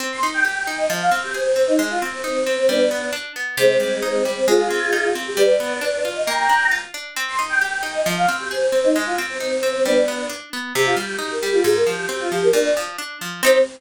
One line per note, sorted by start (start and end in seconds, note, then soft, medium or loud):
0.00 0.20 C4 medium
0.12 0.22 C6 medium
0.23 0.43 D#4 medium
0.34 0.44 G5 medium
0.44 0.65 G4 medium
0.44 0.77 G5 medium
0.67 0.87 D#4 medium
0.78 0.89 D#5 medium
0.90 1.10 F3 medium
1.01 1.12 F5 medium
1.11 1.32 C4 medium
1.23 1.34 G4 medium
1.34 1.54 G#4 medium
1.34 1.65 C5 medium
1.56 1.76 C4 medium
1.67 1.78 D#4 medium
1.79 1.99 G#3 medium
1.90 2.01 F4 medium
2.02 2.22 C4 medium
2.13 2.23 C4 medium
2.24 2.53 C4 medium
2.24 2.44 D#4 medium
2.46 2.67 C4 medium
2.57 2.67 C4 medium
2.68 2.89 G3 medium
2.68 3.06 B3 medium
2.68 3.06 D4 medium
2.91 3.11 B3 medium
3.13 3.33 D4 medium
3.36 3.56 B3 medium
3.57 3.78 C3 medium
3.57 4.23 G#3 medium
3.57 4.23 C4 medium
3.80 4.00 G3 medium
4.02 4.23 D#4 medium
4.25 4.45 G3 medium
4.36 4.47 C4 medium
4.48 4.68 G#3 medium
4.48 5.09 F4 medium
4.48 5.09 G#4 medium
4.70 4.91 C4 medium
4.93 5.13 D#4 medium
5.15 5.36 C4 medium
5.27 5.38 G4 medium
5.37 5.57 G3 medium
5.37 5.99 B4 medium
5.37 5.99 D5 medium
5.60 5.80 B3 medium
5.81 6.01 D4 medium
6.05 6.25 F4 medium
6.15 6.26 D#5 medium
6.26 6.47 A#3 medium
6.26 6.67 G5 medium
6.26 6.67 A#5 medium
6.49 6.70 D4 medium
6.71 6.92 F4 medium
6.94 7.14 D4 medium
7.16 7.37 C4 medium
7.28 7.38 C6 medium
7.39 7.59 D#4 medium
7.49 7.60 G5 medium
7.61 7.82 G4 medium
7.61 7.94 G5 medium
7.83 8.03 D#4 medium
7.94 8.05 D#5 medium
8.06 8.26 F3 medium
8.17 8.28 F5 medium
8.28 8.49 C4 medium
8.40 8.50 G4 medium
8.51 8.71 G#4 medium
8.51 8.82 C5 medium
8.72 8.92 C4 medium
8.84 8.94 D#4 medium
8.96 9.16 G#3 medium
9.06 9.17 F4 medium
9.18 9.38 C4 medium
9.29 9.40 C4 medium
9.40 9.69 C4 medium
9.40 9.61 D#4 medium
9.63 9.83 C4 medium
9.74 9.85 C4 medium
9.85 10.06 G3 medium
9.85 10.22 B3 medium
9.85 10.22 D4 medium
10.08 10.28 B3 medium
10.29 10.50 D4 medium
10.53 10.73 B3 medium
10.75 10.95 C3 loud
10.75 10.85 G4 medium
10.86 10.96 F4 medium
10.97 11.17 G3 medium
10.97 11.17 G4 medium
11.19 11.39 D#4 medium
11.19 11.30 G4 medium
11.31 11.42 A#4 medium
11.42 11.63 G3 medium
11.42 11.52 G4 medium
11.53 11.64 F4 medium
11.64 11.84 G#2 medium
11.64 11.75 G#4 medium
11.75 11.86 A#4 medium
11.87 12.07 F3 medium
11.87 12.08 G4 medium
12.09 12.29 C4 medium
12.09 12.20 G4 medium
12.20 12.31 F4 medium
12.32 12.52 F3 medium
12.32 12.42 G4 medium
12.43 12.54 A#4 medium
12.53 12.73 A#2 medium
12.53 12.74 D4 medium
12.77 12.97 F3 medium
12.98 13.19 D4 medium
13.21 13.41 F3 medium
13.43 13.58 C4 loud
13.43 13.59 C4 loud
13.43 13.58 D#4 loud
13.43 13.58 G4 loud